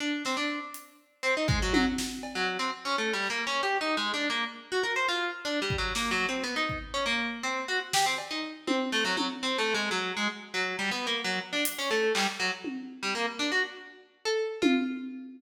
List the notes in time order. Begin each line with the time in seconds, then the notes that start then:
0.00 D4
0.25 C4, snare
0.37 D4
0.74 closed hi-hat
1.23 C4
1.37 D#4
1.48 G#3, kick
1.62 F#3
1.74 F#3, high tom
1.98 snare
2.23 cowbell
2.35 F#3
2.59 C4
2.85 C#4
2.98 A3
3.13 G3
3.22 clap
3.30 A#3
3.47 C#4
3.63 G4
3.81 D#4
3.97 G#3
4.14 D4
4.30 A#3
4.72 F#4
4.83 A#4
4.96 C5
5.08 F4
5.45 D4
5.62 G3
5.70 kick
5.78 F#3
5.95 A#3, snare
6.11 F#3
6.29 C4
6.44 B3
6.56 D#4
6.69 kick
6.94 C#4
7.06 A#3
7.43 C4
7.68 F#4
7.93 G4, snare
8.06 C4
8.18 cowbell
8.31 D#4
8.67 C4, high tom
8.92 A3, clap
9.05 F#3
9.17 F#3, high tom
9.43 C4
9.58 A3
9.74 G#3
9.91 F#3
10.17 G#3
10.54 F#3
10.79 G3
10.91 B3
11.07 A#3
11.24 F#3
11.53 D4
11.65 closed hi-hat
11.79 C#4
11.91 A3
12.15 G3, clap
12.40 F#3
12.64 high tom
13.03 G3
13.15 A#3
13.39 D4
13.52 F#4
14.25 A4
14.62 F4, high tom